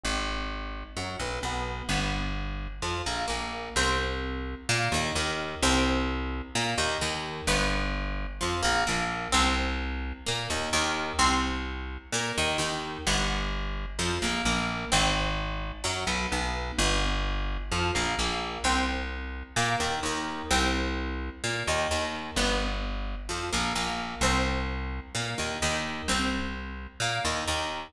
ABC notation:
X:1
M:4/4
L:1/8
Q:1/4=129
K:Cm
V:1 name="Orchestral Harp"
C z3 _G, =B, B,2 | =B, z3 F, _B, B,2 | C z3 B, E, E,2 | C z3 B, E, E,2 |
=B, z3 F, _B, B,2 | C z3 B, E, E,2 | C z3 B, E, E,2 | =B, z3 F, _B, B,2 |
C z3 _G, =B, B,2 | =B, z3 F, _B, B,2 | C z3 B, E, E,2 | C z3 B, E, E,2 |
=B, z3 F, _B, B,2 | C z3 B, E, E,2 | C z3 B, E, E,2 |]
V:2 name="Electric Bass (finger)" clef=bass
A,,,4 _G,, =B,,, B,,,2 | G,,,4 F,, B,,, B,,,2 | C,,4 B,, E,, E,,2 | C,,4 B,, E,, E,,2 |
G,,,4 F,, B,,, B,,,2 | C,,4 B,, E,, E,,2 | C,,4 B,, E,, E,,2 | G,,,4 F,, B,,, B,,,2 |
A,,,4 _G,, =B,,, B,,,2 | G,,,4 F,, B,,, B,,,2 | C,,4 B,, E,, E,,2 | C,,4 B,, E,, E,,2 |
G,,,4 F,, B,,, B,,,2 | C,,4 B,, E,, E,,2 | C,,4 B,, E,, E,,2 |]